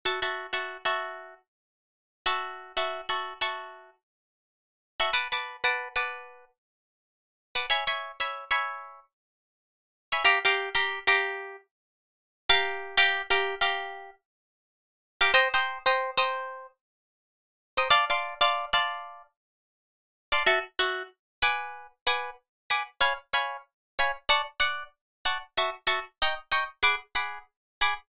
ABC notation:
X:1
M:4/4
L:1/16
Q:"Swing 16ths" 1/4=94
K:F#m
V:1 name="Acoustic Guitar (steel)"
[Feac'] [Feac']2 [Feac']2 [Feac']9 [Feac']2- | [Feac'] [Feac']2 [Feac']2 [Feac']10 [Feac'] | [Bfad'] [Bfad']2 [Bfad']2 [Bfad']10 [Bfad'] | [cegb] [cegb]2 [cegb]2 [cegb]10 [cegb] |
[K:Gm] [Gfbd'] [Gfbd']2 [Gfbd']2 [Gfbd']9 [Gfbd']2- | [Gfbd'] [Gfbd']2 [Gfbd']2 [Gfbd']10 [Gfbd'] | [cgbe'] [cgbe']2 [cgbe']2 [cgbe']10 [cgbe'] | [dfac'] [dfac']2 [dfac']2 [dfac']10 [dfac'] |
[K:F#m] [Feac']2 [Feac']4 [Bfgd']4 [Bfgd']4 [Bfgd']2 | [c^egb]2 [cegb]4 [cegb]2 [dfac']2 [dfac']4 [dfac']2 | [Feac']2 [Feac']2 [^d=g^ac']2 [dgac']2 [^Gfb=d']2 [Gfbd']4 [Gfbd']2 |]